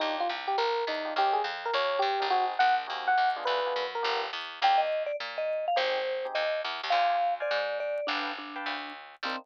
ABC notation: X:1
M:4/4
L:1/8
Q:"Swing" 1/4=208
K:Cm
V:1 name="Electric Piano 1"
E F z G B2 E2 | G A z B _d2 G2 | _G z _g z2 g2 z | _c3 B2 z3 |
z8 | z8 | z8 | z8 |
z8 |]
V:2 name="Vibraphone"
z8 | z8 | z8 | z8 |
g e2 d z e2 f | c4 e2 z2 | f3 d3 d2 | D2 D4 z2 |
C2 z6 |]
V:3 name="Electric Piano 1"
[DEFG]7 [DEFG] | [_DEGB]7 [DEGB] | [CE_GA]4 [CEGA]3 [_CDFA]- | [_CDFA] [CDFA]3 [=B,DFG]4 |
[B,DEG]8 | [CEGA]3 [CEGA]5 | [cdfa]3 [cdfa]5 | [=Bfg=a]3 [Bfga]5 |
[B,CDE]2 z6 |]
V:4 name="Electric Bass (finger)" clef=bass
E,,2 C,,2 B,,,2 =E,,2 | E,,2 F,,2 E,,2 G,, A,,,- | A,,,2 B,,,2 E,,2 E,,2 | D,,2 _G,,2 =G,,,2 =E,,2 |
E,,4 B,,4 | A,,,4 E,,2 =E,, _E,, | D,,4 A,,4 | G,,,4 D,,4 |
C,,2 z6 |]